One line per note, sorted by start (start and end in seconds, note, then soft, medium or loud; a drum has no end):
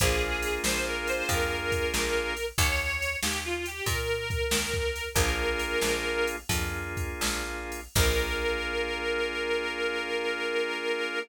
0.00 0.59 A#1 loud
0.00 2.33 A#3 loud
0.00 2.33 D4 loud
0.00 2.33 F4 loud
0.00 0.57 G#4 loud
0.00 2.33 G#4 loud
0.00 kick medium
0.00 ride loud
0.42 ride medium
0.64 1.22 A#1 medium
0.64 0.85 C5 loud
0.64 snare loud
0.87 1.07 A#4 medium
1.07 1.29 C5 loud
1.07 ride medium
1.29 1.87 F2 medium
1.29 2.45 A#4 medium
1.29 kick medium
1.29 ride medium
1.72 kick medium
1.72 ride medium
1.94 2.52 A#1 medium
1.94 snare medium
2.37 ride medium
2.58 3.16 D#2 medium
2.58 3.17 C#5 loud
2.58 kick loud
2.58 ride loud
3.02 ride medium
3.23 3.81 D#2 medium
3.23 3.43 G4 loud
3.23 snare loud
3.45 3.65 F4 medium
3.66 3.87 G4 loud
3.66 ride medium
3.86 4.44 A#2 medium
3.86 5.09 A#4 loud
3.86 kick medium
3.86 ride medium
4.30 kick medium
4.30 ride medium
4.51 5.09 D#2 medium
4.51 snare loud
4.74 kick medium
4.96 ride medium
5.14 5.75 A#1 loud
5.14 6.36 A#3 loud
5.14 6.36 D4 loud
5.14 6.36 F4 loud
5.14 6.36 G#4 loud
5.14 6.29 A#4 loud
5.14 kick loud
5.14 ride loud
5.59 ride medium
5.81 6.44 A#1 medium
5.81 snare medium
6.27 ride medium
6.49 7.13 F2 medium
6.49 7.80 A#3 medium
6.49 7.80 D4 medium
6.49 7.80 F4 medium
6.49 7.80 G#4 medium
6.49 kick medium
6.49 ride loud
6.97 kick medium
6.97 ride medium
7.21 7.88 A#1 medium
7.21 snare loud
7.72 ride medium
7.95 11.19 A#1 loud
7.95 11.19 A#3 loud
7.95 11.19 D4 loud
7.95 11.19 F4 medium
7.95 11.19 G#4 loud
7.95 11.19 A#4 loud
7.95 kick loud
7.95 crash loud